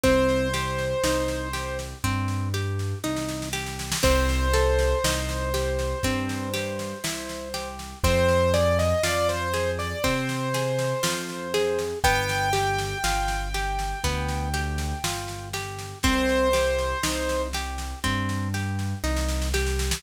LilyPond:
<<
  \new Staff \with { instrumentName = "Acoustic Grand Piano" } { \time 4/4 \key c \minor \tempo 4 = 60 c''2 r2 | c''1 | c''8 d''16 ees''16 d''16 c''8 d''16 c''2 | g''1 |
c''4. r2 r8 | }
  \new Staff \with { instrumentName = "Orchestral Harp" } { \time 4/4 \key c \minor c'8 g'8 ees'8 g'8 c'8 g'8 ees'8 g'8 | c'8 a'8 ees'8 g'8 c'8 g'8 e'8 g'8 | c'8 aes'8 f'8 aes'8 c'8 aes'8 f'8 aes'8 | b8 g'8 f'8 g'8 b8 g'8 f'8 g'8 |
c'8 g'8 ees'8 g'8 c'8 g'8 ees'8 g'8 | }
  \new Staff \with { instrumentName = "Acoustic Grand Piano" } { \clef bass \time 4/4 \key c \minor c,4 c,4 g,4 c,4 | c,4 c,4 g,4 c,4 | f,4 f,4 c4 f,4 | g,,4 g,,4 d,4 g,,4 |
c,4 c,4 g,4 c,4 | }
  \new DrumStaff \with { instrumentName = "Drums" } \drummode { \time 4/4 <bd sn>16 sn16 sn16 sn16 sn16 sn16 sn16 sn16 <bd sn>16 sn16 sn16 sn16 sn32 sn32 sn32 sn32 sn32 sn32 sn32 sn32 | <cymc bd sn>16 sn16 sn16 sn16 sn16 sn16 sn16 sn16 <bd sn>16 sn16 sn16 sn16 sn16 sn16 sn16 sn16 | <bd sn>16 sn16 sn16 sn16 sn16 sn16 sn16 sn16 <bd sn>16 sn16 sn16 sn16 sn16 sn16 sn16 sn16 | <bd sn>16 sn16 sn16 sn16 sn16 sn16 sn16 sn16 <bd sn>16 sn16 sn16 sn16 sn16 sn16 sn16 sn16 |
<bd sn>16 sn16 sn16 sn16 sn16 sn16 sn16 sn16 <bd sn>16 sn16 sn16 sn16 sn32 sn32 sn32 sn32 sn32 sn32 sn32 sn32 | }
>>